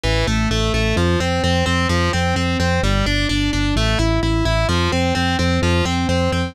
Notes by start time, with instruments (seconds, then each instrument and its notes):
0.03 synth bass 1 A1, overdriven guitar E3
0.27 synth bass 1 A1, overdriven guitar A3
0.51 synth bass 1 A1, overdriven guitar A3
0.74 synth bass 1 A1, overdriven guitar A3
0.96 synth bass 1 F2, overdriven guitar F3
1.20 synth bass 1 F2, overdriven guitar C4
1.44 synth bass 1 F2, overdriven guitar C4
1.66 synth bass 1 F2, overdriven guitar C4
1.89 synth bass 1 F2, overdriven guitar F3
2.13 synth bass 1 F2, overdriven guitar C4
2.36 synth bass 1 F2, overdriven guitar C4
2.60 synth bass 1 F2, overdriven guitar C4
2.83 synth bass 1 G1, overdriven guitar G3
3.06 synth bass 1 G1, overdriven guitar D4
3.29 synth bass 1 G1, overdriven guitar D4
3.53 synth bass 1 G1, overdriven guitar D4
3.76 synth bass 1 A1, overdriven guitar A3
3.99 synth bass 1 A1, overdriven guitar E4
4.23 synth bass 1 A1, overdriven guitar E4
4.45 synth bass 1 A1, overdriven guitar E4
4.69 synth bass 1 F2, overdriven guitar F3
4.92 synth bass 1 F2, overdriven guitar C4
5.15 synth bass 1 F2, overdriven guitar C4
5.39 synth bass 1 F2, overdriven guitar C4
5.62 synth bass 1 F2, overdriven guitar F3
5.85 synth bass 1 F2, overdriven guitar C4
6.09 synth bass 1 F2, overdriven guitar C4
6.32 synth bass 1 F2, overdriven guitar C4